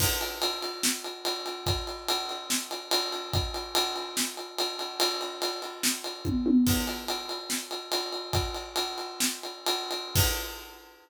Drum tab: CC |x-------|--------|--------|--------|
RD |-xxx-xxx|xxxx-xxx|xxxx-xxx|xxxx-x--|
SD |----o---|----o---|----o---|----o---|
T1 |--------|--------|--------|------oo|
BD |o-------|o-------|o-------|------o-|

CC |x-------|--------|x-------|
RD |-xxx-xxx|xxxx-xxx|--------|
SD |----o---|----o---|--------|
T1 |--------|--------|--------|
BD |o-------|o-------|o-------|